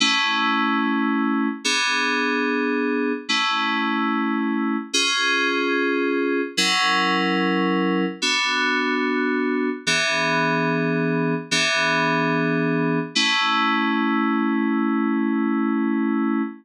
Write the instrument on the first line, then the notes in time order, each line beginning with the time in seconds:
electric piano 2
0.00 A3 C#4 E4
1.64 B3 D4 G#4
3.29 A3 C#4 E4
4.93 C#4 F4 G#4
6.57 F#3 C#4 E4 A#4
8.22 B3 D4 F#4
9.87 E3 B3 D4 G#4
11.51 E3 B3 D4 G#4
13.15 A3 C#4 E4